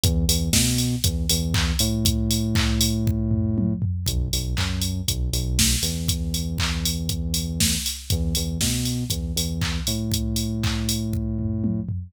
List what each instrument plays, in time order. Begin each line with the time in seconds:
0.04 synth bass 1 E2, kick, closed hi-hat
0.28 synth bass 1 E2, open hi-hat
0.53 synth bass 1 B2, kick, snare
0.78 open hi-hat
1.04 synth bass 1 E2, kick, closed hi-hat
1.30 synth bass 1 E2, open hi-hat
1.54 kick, clap
1.79 synth bass 1 A2, open hi-hat
2.05 kick, closed hi-hat
2.31 open hi-hat
2.55 kick, clap
2.81 open hi-hat
3.07 kick
3.31 floor tom
3.58 high tom
3.82 floor tom
4.06 synth bass 1 B1, kick, closed hi-hat
4.33 synth bass 1 B1, open hi-hat
4.57 synth bass 1 F#2, kick, clap
4.82 open hi-hat
5.08 synth bass 1 B1, kick, closed hi-hat
5.33 synth bass 1 B1, open hi-hat
5.59 kick, snare
5.83 synth bass 1 E2, open hi-hat
6.08 kick, closed hi-hat
6.34 open hi-hat
6.58 kick, clap
6.85 open hi-hat
7.09 kick, closed hi-hat
7.34 open hi-hat
7.60 kick, snare
7.86 open hi-hat
8.10 synth bass 1 E2, kick, closed hi-hat
8.35 synth bass 1 E2, open hi-hat
8.61 synth bass 1 B2, kick, snare
8.85 open hi-hat
9.10 synth bass 1 E2, kick, closed hi-hat
9.36 synth bass 1 E2, open hi-hat
9.61 kick, clap
9.87 synth bass 1 A2, open hi-hat
10.12 kick, closed hi-hat
10.36 open hi-hat
10.63 kick, clap
10.89 open hi-hat
11.13 kick
11.39 floor tom
11.64 high tom
11.89 floor tom